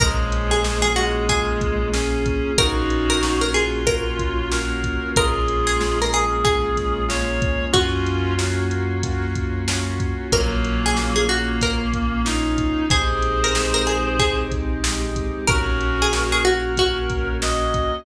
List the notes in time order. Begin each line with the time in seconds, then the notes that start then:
0.00 A#1 F3 G#3 A#3 C#4 F4 G#4 A#4, kick, closed hi-hat
0.32 closed hi-hat
0.51 G#4
0.64 A#3 C#4 F4 G#4, snare
0.82 G#4
0.96 G#3 F#4, closed hi-hat
1.29 A#3 C#4 F4 G#4, kick, closed hi-hat
1.61 kick, closed hi-hat
1.93 A#3 C#4 F4 G#4, snare
2.26 kick, closed hi-hat
2.58 A#1 A#3 C#4 D#4 F4 F#4 A#4, kick, closed hi-hat
2.90 closed hi-hat
3.10 A#4
3.23 A#3 C#4 F4 F#4, snare
3.41 A#4
3.54 F4 G#4, closed hi-hat
3.87 A#3 C#4 F4 F#4 A#4, kick, closed hi-hat
4.19 kick, closed hi-hat
4.51 A#3 C#4 F4 F#4 A#4, snare
4.84 kick, closed hi-hat
5.16 A#1 G#3 A#3 C#4 F4 G#4 A#4, kick, closed hi-hat
5.48 closed hi-hat
5.67 G#4
5.80 G#3 A#3 C#4 F4, snare
6.02 A#4
6.13 G#4, closed hi-hat
6.44 G#3 A#3 C#4 F4 G#4, kick, closed hi-hat
6.77 kick, snare, closed hi-hat
7.09 G#3 A#3 C#4 F4 C#5, snare
7.42 kick, closed hi-hat
7.73 F#2 A#3 C#4 F4 F#4, kick, closed hi-hat
8.06 closed hi-hat
8.38 A#3 C#4 F4 F#4, snare
8.71 closed hi-hat
9.03 A#3 C#4 F4 F#4, kick, closed hi-hat
9.35 kick, closed hi-hat
9.68 A#3 C#4 F4 F#4, snare
10.00 kick, closed hi-hat
10.32 A#1 F#3 A#3 C#4 F4 A#4, kick, closed hi-hat
10.65 closed hi-hat
10.86 G#4
10.97 A#3 C#4 F4, snare
11.16 G#4
11.29 A#3 F#4, closed hi-hat
11.61 A#3 C#4 F4 A#4, kick, closed hi-hat
11.94 kick, closed hi-hat
12.25 A#3 C#4 D#4 F4, snare
12.58 kick, closed hi-hat
12.90 A#1 G#3 C4 D#4 G4 G#4 C5, kick, closed hi-hat
13.22 closed hi-hat
13.44 A#4
13.54 G#3 C4 D#4 G4, snare
13.74 A#4
13.87 G#4, closed hi-hat
14.19 G#3 C4 D#4 G4 G#4, kick, closed hi-hat
14.52 kick, closed hi-hat
14.84 G#3 C4 D#4 G4, snare
15.16 kick, closed hi-hat
15.47 A#1 A#3 C#4 F#4 A#4, kick, closed hi-hat
15.81 closed hi-hat
16.02 G#4
16.12 A#3 C#4 F#4, snare
16.32 G#4
16.45 F#4 A#4, closed hi-hat
16.77 A#3 C#4 F#4, kick, closed hi-hat
17.10 kick, closed hi-hat
17.42 A#3 C#4 F#4 D#5, snare
17.74 kick, closed hi-hat